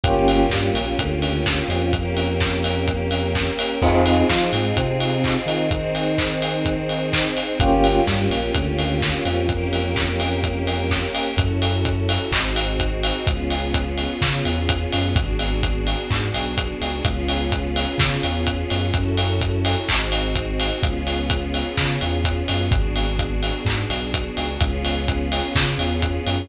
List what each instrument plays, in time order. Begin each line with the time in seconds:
0.04 synth bass 2 G1, string ensemble 1 A#3 C#4 F4 G4, electric piano 1 A#3 C#4 F4 G4, kick, closed hi-hat
0.28 open hi-hat
0.50 synth bass 2 G2, electric piano 1 G3, kick, snare
0.73 synth bass 2 A#1, electric piano 1 A#3, open hi-hat
0.99 synth bass 2 D2, electric piano 1 D3, kick, closed hi-hat
1.22 open hi-hat
1.46 kick, snare
1.68 synth bass 2 F2, electric piano 1 F3, open hi-hat
1.93 string ensemble 1 A#3 C#4 G4 A#4, kick, closed hi-hat
2.17 open hi-hat
2.40 kick, snare
2.64 open hi-hat
2.88 kick, closed hi-hat
3.11 open hi-hat
3.35 kick, snare
3.59 open hi-hat
3.82 synth bass 2 F2, string ensemble 1 C4 D#4 F4 G#4, electric piano 1 C4 D#4 F4 G#4, kick, crash
4.06 open hi-hat
4.29 synth bass 2 F3, electric piano 1 F4, kick, snare
4.53 synth bass 2 G#2, electric piano 1 G#3, open hi-hat
4.76 synth bass 2 C3, electric piano 1 C4, kick, closed hi-hat
5.00 open hi-hat
5.24 kick, clap
5.46 synth bass 2 D#3, electric piano 1 D#4, open hi-hat
5.71 string ensemble 1 C4 D#4 G#4 C5, kick, closed hi-hat
5.95 open hi-hat
6.18 kick, snare
6.42 open hi-hat
6.65 kick, closed hi-hat
6.89 open hi-hat
7.13 kick, snare
7.37 open hi-hat
7.60 synth bass 2 G1, string ensemble 1 A#3 C#4 F4 G4, electric piano 1 A#3 C#4 F4 G4, kick, closed hi-hat
7.84 open hi-hat
8.06 synth bass 2 G2, electric piano 1 G3, kick, snare
8.30 synth bass 2 A#1, electric piano 1 A#3, open hi-hat
8.54 synth bass 2 D2, electric piano 1 D3, kick, closed hi-hat
8.79 open hi-hat
9.02 kick, snare
9.25 synth bass 2 F2, electric piano 1 F3, open hi-hat
9.49 string ensemble 1 A#3 C#4 G4 A#4, kick, closed hi-hat
9.73 open hi-hat
9.96 kick, snare
10.20 open hi-hat
10.44 kick, closed hi-hat
10.67 open hi-hat
10.91 kick, snare
11.15 open hi-hat
11.37 synth bass 2 F#2, string ensemble 1 C#4 E4 F#4 A4, kick, closed hi-hat
11.62 open hi-hat
11.85 kick, closed hi-hat
12.09 open hi-hat
12.31 synth bass 2 G#1, string ensemble 1 C4 D#4 F#4 G#4, kick, clap
12.56 open hi-hat
12.80 kick, closed hi-hat
13.03 open hi-hat
13.26 synth bass 2 C#2, string ensemble 1 B3 C#4 F4 G#4, kick, closed hi-hat
13.50 open hi-hat
13.74 kick, closed hi-hat
13.98 open hi-hat
14.21 synth bass 2 C#3, kick, snare
14.45 synth bass 2 E2, open hi-hat
14.69 kick, closed hi-hat
14.92 synth bass 2 F#2, open hi-hat
15.15 synth bass 2 G#1, string ensemble 1 B3 D4 F#4 G#4, kick, closed hi-hat
15.39 open hi-hat
15.63 kick, closed hi-hat
15.87 open hi-hat
16.10 synth bass 2 G#2, kick, clap
16.34 synth bass 2 B1, open hi-hat
16.58 kick, closed hi-hat
16.81 synth bass 2 C#2, open hi-hat
17.05 synth bass 2 C#2, string ensemble 1 B3 C#4 F4 G#4, kick, closed hi-hat
17.28 open hi-hat
17.52 kick, closed hi-hat
17.76 open hi-hat
17.98 synth bass 2 C#3, kick, snare
18.23 synth bass 2 E2, open hi-hat
18.47 kick, closed hi-hat
18.70 synth bass 2 F#2, open hi-hat
18.94 synth bass 2 F#2, string ensemble 1 C#4 E4 F#4 A4, kick, closed hi-hat
19.17 open hi-hat
19.41 kick, closed hi-hat
19.65 open hi-hat
19.88 synth bass 2 G#1, string ensemble 1 C4 D#4 F#4 G#4, kick, clap
20.12 open hi-hat
20.35 kick, closed hi-hat
20.60 open hi-hat
20.83 synth bass 2 C#2, string ensemble 1 B3 C#4 F4 G#4, kick, closed hi-hat
21.07 open hi-hat
21.30 kick, closed hi-hat
21.54 open hi-hat
21.77 synth bass 2 C#3, kick, snare
22.01 synth bass 2 E2, open hi-hat
22.24 kick, closed hi-hat
22.48 synth bass 2 F#2, open hi-hat
22.71 synth bass 2 G#1, string ensemble 1 B3 D4 F#4 G#4, kick, closed hi-hat
22.96 open hi-hat
23.19 kick, closed hi-hat
23.43 open hi-hat
23.65 synth bass 2 G#2, kick, clap
23.90 synth bass 2 B1, open hi-hat
24.14 kick, closed hi-hat
24.37 synth bass 2 C#2, open hi-hat
24.61 synth bass 2 C#2, string ensemble 1 B3 C#4 F4 G#4, kick, closed hi-hat
24.85 open hi-hat
25.08 kick, closed hi-hat
25.32 open hi-hat
25.55 synth bass 2 C#3, kick, snare
25.78 synth bass 2 E2, open hi-hat
26.02 kick, closed hi-hat
26.26 synth bass 2 F#2, open hi-hat